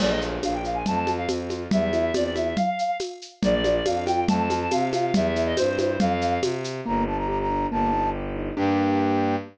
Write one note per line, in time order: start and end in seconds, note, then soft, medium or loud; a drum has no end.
0.00 0.38 A#1 medium
0.00 0.19 A#3 medium
0.00 0.10 D5 loud
0.00 crash loud
0.00 low conga medium
0.00 shaker medium
0.10 0.21 D#5 medium
0.21 0.40 F4 medium
0.21 shaker medium
0.43 0.83 A#1 medium
0.43 0.62 D4 medium
0.43 0.53 F5 medium
0.43 tambourine medium
0.43 high conga medium
0.43 shaker medium
0.54 0.64 G5 medium
0.64 0.83 F4 medium
0.64 0.76 F5 medium
0.64 shaker medium
0.74 0.85 G#5 medium
0.86 1.26 F2 medium
0.86 1.06 A3 medium
0.86 1.14 A5 loud
0.86 low conga medium
0.86 shaker medium
1.07 1.26 F4 medium
1.07 high conga medium
1.07 shaker medium
1.18 1.28 F5 medium
1.28 1.67 F2 medium
1.28 1.48 C4 medium
1.28 tambourine medium
1.28 high conga medium
1.28 shaker medium
1.50 1.70 F4 medium
1.50 high conga medium
1.50 shaker medium
1.71 2.10 E2 medium
1.71 1.91 G3 medium
1.71 2.13 E5 medium
1.71 low conga loud
1.71 shaker medium
1.93 2.12 E4 medium
1.93 high conga medium
1.93 shaker medium
2.14 2.53 E2 medium
2.14 2.33 C4 medium
2.14 2.23 D5 medium
2.14 tambourine medium
2.14 high conga medium
2.14 shaker medium
2.24 2.34 D5 medium
2.35 2.55 E4 medium
2.35 2.55 E5 medium
2.35 high conga medium
2.35 shaker medium
2.56 2.97 F5 loud
2.56 low conga medium
2.56 shaker medium
2.79 shaker medium
3.00 tambourine medium
3.00 high conga medium
3.00 shaker medium
3.22 shaker medium
3.42 3.81 A#1 medium
3.42 3.62 A#3 medium
3.42 3.74 D5 loud
3.42 low conga loud
3.42 shaker medium
3.64 3.84 F4 medium
3.64 high conga medium
3.64 shaker medium
3.75 3.85 D5 medium
3.85 4.24 F2 medium
3.85 4.05 D4 medium
3.85 4.04 F5 medium
3.85 tambourine medium
3.85 high conga medium
3.85 shaker medium
4.06 4.26 F4 medium
4.06 4.24 G5 loud
4.06 high conga medium
4.06 shaker medium
4.28 4.67 F2 medium
4.28 4.48 A3 medium
4.28 4.59 A5 loud
4.28 low conga loud
4.28 shaker medium
4.50 4.69 F4 medium
4.50 high conga medium
4.50 shaker medium
4.62 4.72 A5 medium
4.71 5.11 C3 medium
4.71 4.90 C4 medium
4.71 4.89 F5 medium
4.71 tambourine medium
4.71 high conga medium
4.71 shaker medium
4.93 5.12 F4 medium
4.93 5.13 F5 medium
4.93 high conga medium
4.93 shaker medium
5.14 5.53 E2 medium
5.14 5.33 G3 medium
5.14 5.44 E5 medium
5.14 low conga loud
5.14 shaker medium
5.36 5.55 E4 medium
5.36 shaker medium
5.46 5.56 D#5 medium
5.57 5.97 G2 medium
5.57 5.77 C4 medium
5.57 5.77 C5 loud
5.57 tambourine medium
5.57 high conga medium
5.57 shaker medium
5.78 5.98 E4 medium
5.78 5.99 C5 medium
5.78 high conga medium
5.78 shaker medium
5.99 6.38 F2 medium
5.99 6.40 F5 loud
5.99 low conga loud
5.99 shaker medium
6.21 shaker medium
6.42 6.81 C3 medium
6.42 tambourine medium
6.42 high conga loud
6.42 shaker medium
6.64 shaker medium
6.86 7.66 G1 medium
6.86 7.05 A#3 medium
6.86 7.03 A#5 loud
7.07 7.27 D4 medium
7.07 7.17 A5 medium
7.17 7.28 A#5 medium
7.28 7.48 G4 medium
7.28 7.38 A#5 loud
7.40 7.67 A#5 loud
7.50 7.70 D4 medium
7.71 8.50 G1 medium
7.71 7.91 A#3 medium
7.71 8.10 A5 loud
7.93 8.12 D#4 medium
8.15 8.34 G4 medium
8.36 8.55 D#4 medium
8.56 9.36 G2 loud
8.56 9.36 A#3 medium
8.56 9.36 D4 loud
8.56 9.36 G4 loud
8.56 9.35 G5 loud